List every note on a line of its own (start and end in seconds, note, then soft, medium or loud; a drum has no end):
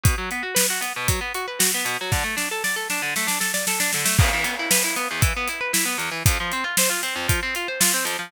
0.03 0.15 B2 medium
0.03 kick loud
0.03 closed hi-hat loud
0.18 0.30 F#3 medium
0.31 0.43 B3 medium
0.31 closed hi-hat medium
0.43 0.54 F#4 medium
0.55 0.66 B4 medium
0.55 snare loud
0.70 0.82 F#4 medium
0.81 0.93 B3 medium
0.81 closed hi-hat medium
0.96 1.08 B2 medium
1.08 1.20 F#3 medium
1.08 kick loud
1.08 closed hi-hat loud
1.21 1.32 B3 medium
1.34 1.46 F#4 medium
1.34 closed hi-hat medium
1.48 1.59 B4 medium
1.59 1.71 F#4 medium
1.59 snare loud
1.74 1.86 B3 medium
1.85 1.97 B2 medium
1.85 closed hi-hat medium
2.01 2.13 F#3 medium
2.12 2.24 D3 loud
2.12 kick loud
2.12 snare medium
2.24 2.36 A3 medium
2.37 2.48 D4 medium
2.37 snare medium
2.51 2.63 A4 medium
2.64 2.76 D5 medium
2.64 snare medium
2.76 2.88 A4 medium
2.90 3.02 D4 medium
2.90 snare medium
3.02 3.14 D3 medium
3.16 3.28 A3 medium
3.16 snare medium
3.27 3.39 D4 medium
3.27 snare medium
3.40 3.52 A4 medium
3.40 snare medium
3.54 3.66 D5 medium
3.54 snare medium
3.67 3.79 A4 medium
3.67 snare loud
3.80 3.91 D4 medium
3.80 snare loud
3.93 4.06 D3 medium
3.93 snare medium
4.05 4.17 A3 medium
4.05 snare loud
4.18 4.30 E2 loud
4.18 kick loud
4.18 crash loud
4.33 4.45 E3 medium
4.44 4.56 B3 medium
4.44 closed hi-hat loud
4.59 4.71 E4 medium
4.71 4.83 B4 medium
4.71 snare loud
4.84 4.96 E4 medium
4.96 5.08 B3 medium
4.96 closed hi-hat medium
5.11 5.22 E2 medium
5.21 5.33 E3 medium
5.21 kick loud
5.21 closed hi-hat loud
5.37 5.48 B3 medium
5.48 5.60 E4 medium
5.48 closed hi-hat medium
5.61 5.72 B4 medium
5.73 5.85 E4 medium
5.73 snare loud
5.85 5.97 B3 medium
5.98 6.10 E2 medium
5.98 closed hi-hat medium
6.11 6.23 E3 medium
6.26 6.37 F2 loud
6.26 kick loud
6.26 closed hi-hat loud
6.40 6.52 F3 medium
6.52 6.64 C4 medium
6.52 closed hi-hat medium
6.64 6.76 F4 medium
6.77 6.90 C5 loud
6.77 snare loud
6.90 7.01 F4 medium
7.03 7.15 C4 medium
7.03 closed hi-hat medium
7.16 7.27 F2 medium
7.28 7.40 F3 medium
7.28 kick loud
7.28 closed hi-hat loud
7.43 7.54 C4 medium
7.55 7.67 F4 medium
7.55 closed hi-hat medium
7.68 7.80 C5 medium
7.80 7.92 F4 medium
7.80 snare loud
7.94 8.05 C4 medium
8.05 8.17 F2 medium
8.05 closed hi-hat medium
8.19 8.30 F3 medium